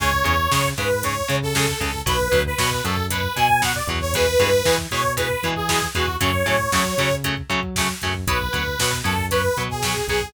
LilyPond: <<
  \new Staff \with { instrumentName = "Lead 2 (sawtooth)" } { \time 4/4 \key cis \phrygian \tempo 4 = 116 cis''4. b'8 cis''8. a'8. a'8 | b'8. b'8. a'8 b'8 gis''8 fis''16 d''16 r16 cis''16 | b'4. cis''8 b'8. gis'8. fis'8 | cis''2 r2 |
b'4. a'8 b'8. gis'8. gis'8 | }
  \new Staff \with { instrumentName = "Overdriven Guitar" } { \time 4/4 \key cis \phrygian <cis gis>8 <cis gis>8 <cis gis>8 <cis gis>8 <cis gis>8 <cis gis>8 <cis gis>8 <cis gis>8 | <b, fis>8 <b, fis>8 <b, fis>8 <b, fis>8 <b, fis>8 <b, fis>8 <b, fis>8 <b, fis>8 | <b, e gis>8 <b, e gis>8 <b, e gis>8 <b, e gis>8 <b, e gis>8 <b, e gis>8 <b, e gis>8 <b, e gis>8 | <cis fis a>8 <cis fis a>8 <cis fis a>8 <cis fis a>8 <cis fis a>8 <cis fis a>8 <cis fis a>8 <cis fis a>8 |
<fis b>8 <fis b>8 <fis b>8 <fis b>8 <fis b>8 <fis b>8 <fis b>8 <fis b>8 | }
  \new Staff \with { instrumentName = "Synth Bass 1" } { \clef bass \time 4/4 \key cis \phrygian cis,8 e,8 cis8 gis,4 cis4 cis,8 | b,,8 d,8 b,8 fis,4 b,4 e,8~ | e,8 g,8 e8 b,4 e4 e,8 | fis,8 a,8 fis8 cis4 fis4 fis,8 |
b,,8 d,8 b,8 fis,4 b,4 b,,8 | }
  \new DrumStaff \with { instrumentName = "Drums" } \drummode { \time 4/4 <cymc bd>16 bd16 <hh bd>16 bd16 <bd sn>16 bd16 <hh bd>16 bd16 <hh bd>16 bd16 <hh bd>16 bd16 <bd sn>16 bd16 <hh bd>16 bd16 | <hh bd>16 bd16 <hh bd>16 bd16 <bd sn>16 bd16 <hh bd>16 bd16 <hh bd>16 bd16 <hh bd>16 bd16 <bd sn>16 bd16 <hh bd>16 bd16 | <hh bd>16 bd16 <hh bd>16 bd16 <bd sn>16 bd16 <hh bd>16 bd16 <hh bd>16 bd16 <hh bd>16 bd16 <bd sn>16 bd16 <hh bd>16 bd16 | <hh bd>16 bd16 <hh bd>16 bd16 <bd sn>16 bd16 <hh bd>16 bd16 <hh bd>16 bd16 <hh bd>16 bd16 <bd sn>16 bd16 <hh bd>16 bd16 |
<hh bd>16 bd16 <hh bd>16 bd16 <bd sn>16 bd16 <hh bd>16 bd16 <hh bd>16 bd16 <hh bd>16 bd16 <bd sn>16 bd16 <hh bd>16 bd16 | }
>>